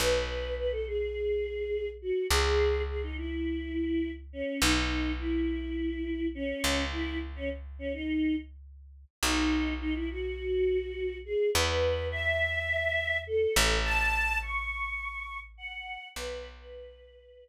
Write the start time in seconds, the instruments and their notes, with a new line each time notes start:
0.00 electric bass (finger) B1, choir aahs B4
0.58 choir aahs B4
0.72 choir aahs A4
0.87 choir aahs G#4
2.02 choir aahs F#4
2.31 electric bass (finger) C#2, choir aahs G#4
2.88 choir aahs G#4
3.03 choir aahs D#4
3.17 choir aahs E4
4.33 choir aahs C#4
4.62 electric bass (finger) B1, choir aahs D#4
5.19 choir aahs E4
6.35 choir aahs C#4
6.64 electric bass (finger) C#2
6.92 choir aahs E4
7.36 choir aahs C#4
7.79 choir aahs C#4
7.93 choir aahs D#4
9.23 electric bass (finger) B1, choir aahs D#4
9.81 choir aahs D#4
9.95 choir aahs E4
10.10 choir aahs F#4
11.25 choir aahs G#4
11.54 electric bass (finger) E2, choir aahs B4
12.11 choir aahs E5
13.27 choir aahs A4
13.56 electric bass (finger) A1
13.85 choir aahs A5
14.42 choir aahs C#6
15.58 choir aahs F#5
16.15 electric bass (finger) B1, choir aahs B4
16.59 choir aahs B4